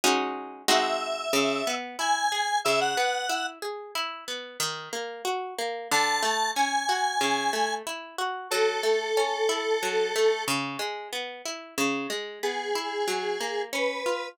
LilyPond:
<<
  \new Staff \with { instrumentName = "Lead 1 (square)" } { \time 4/4 \key cis \minor \tempo 4 = 92 r4 e''2 gis''4 | \time 5/4 e''16 fis''4~ fis''16 r2. r8 | \time 4/4 a''4 gis''2 r4 | \time 5/4 a'2.~ a'8 r4. |
\time 4/4 r4 gis'2 b'4 | }
  \new Staff \with { instrumentName = "Pizzicato Strings" } { \time 4/4 \key cis \minor <gis cis' dis' fis'>4 <gis bis dis' fis'>4 cis8 b8 e'8 gis'8 | \time 5/4 cis8 b8 e'8 gis'8 e'8 b8 dis8 ais8 fis'8 ais8 | \time 4/4 d8 a8 cis'8 fis'8 cis8 a8 e'8 fis'8 | \time 5/4 fis8 a8 cis'8 e'8 fis8 a8 cis8 gis8 b8 e'8 |
\time 4/4 cis8 gis8 b8 e'8 fis8 ais8 cis'8 eis'8 | }
>>